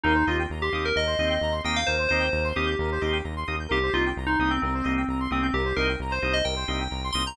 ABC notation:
X:1
M:4/4
L:1/16
Q:1/4=131
K:Cm
V:1 name="Electric Piano 2"
E2 F z2 G2 B e6 g f | c2 c4 G6 z4 | G2 F z2 E2 C C6 C C | G2 B z2 c2 e g6 c' b |]
V:2 name="Drawbar Organ"
[B,CEG]2 [B,CEG]4 [B,CEG]4 [B,CEG]4 [B,CEG]2- | [B,CEG]2 [B,CEG]4 [B,CEG]4 [B,CEG]4 [B,CEG]2 | [B,CEG]2 [B,CEG]4 [B,CEG]4 [B,CEG]4 [B,CEG]2- | [B,CEG]2 [B,CEG]4 [B,CEG]4 [B,CEG]4 [B,CEG]2 |]
V:3 name="Lead 1 (square)"
B c e g b c' e' g' B c e g b c' e' g' | B c e g b c' e' g' B c e g b c' e' g' | B c e g b c' e' g' B c e g b c' e' g' | B c e g b c' e' g' B c e g b c' e' g' |]
V:4 name="Synth Bass 1" clef=bass
E,,2 E,,2 E,,2 E,,2 E,,2 E,,2 E,,2 E,,2 | E,,2 E,,2 E,,2 E,,2 E,,2 E,,2 E,,2 E,,2 | C,,2 C,,2 C,,2 C,,2 C,,2 C,,2 C,,2 C,,2 | C,,2 C,,2 C,,2 C,,2 C,,2 C,,2 C,,2 C,,2 |]